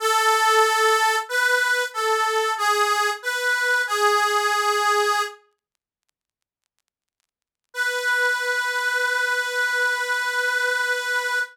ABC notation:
X:1
M:12/8
L:1/8
Q:3/8=62
K:B
V:1 name="Harmonica"
=A4 B2 A2 G2 B2 | G5 z7 | B12 |]